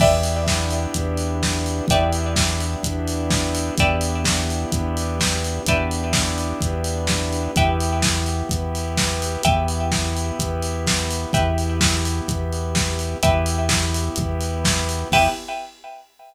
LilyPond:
<<
  \new Staff \with { instrumentName = "Lead 2 (sawtooth)" } { \time 4/4 \key e \minor \tempo 4 = 127 <b d' e' g'>1 | <b d' e' g'>1 | <b d' e' g'>1 | <b d' e' g'>1 |
<b e' g'>1 | <b e' g'>1 | <b e' g'>1 | <b e' g'>1 |
<b e' g'>4 r2. | }
  \new Staff \with { instrumentName = "Pizzicato Strings" } { \time 4/4 \key e \minor <b' d'' e'' g''>1 | <b' d'' e'' g''>1 | <b' d'' e'' g''>1 | <b' d'' e'' g''>1 |
<b' e'' g''>1 | <b' e'' g''>1 | <b' e'' g''>1 | <b' e'' g''>1 |
<b' e'' g''>4 r2. | }
  \new Staff \with { instrumentName = "Synth Bass 1" } { \clef bass \time 4/4 \key e \minor e,2 e,2 | e,2 e,2 | e,2 e,2 | e,2 e,2 |
e,2 e,2 | e,2 e,2 | e,2 e,2 | e,2 e,2 |
e,4 r2. | }
  \new Staff \with { instrumentName = "Pad 2 (warm)" } { \time 4/4 \key e \minor <b d' e' g'>2 <b d' g' b'>2 | <b d' e' g'>2 <b d' g' b'>2 | <b d' e' g'>2 <b d' g' b'>2 | <b d' e' g'>2 <b d' g' b'>2 |
<b e' g'>2 <b g' b'>2 | <b e' g'>2 <b g' b'>2 | <b e' g'>2 <b g' b'>2 | <b e' g'>2 <b g' b'>2 |
<b e' g'>4 r2. | }
  \new DrumStaff \with { instrumentName = "Drums" } \drummode { \time 4/4 <cymc bd>8 hho8 <bd sn>8 hho8 <hh bd>8 hho8 <bd sn>8 hho8 | <hh bd>8 hho8 <bd sn>8 hho8 <hh bd>8 hho8 <bd sn>8 hho8 | <hh bd>8 hho8 <bd sn>8 hho8 <hh bd>8 hho8 <bd sn>8 hho8 | <hh bd>8 hho8 <bd sn>8 hho8 <hh bd>8 hho8 <bd sn>8 hho8 |
<hh bd>8 hho8 <bd sn>8 hho8 <hh bd>8 hho8 <bd sn>8 hho8 | <hh bd>8 hho8 <bd sn>8 hho8 <hh bd>8 hho8 <bd sn>8 hho8 | <hh bd>8 hho8 <bd sn>8 hho8 <hh bd>8 hho8 <bd sn>8 hho8 | <hh bd>8 hho8 <bd sn>8 hho8 <hh bd>8 hho8 <bd sn>8 hho8 |
<cymc bd>4 r4 r4 r4 | }
>>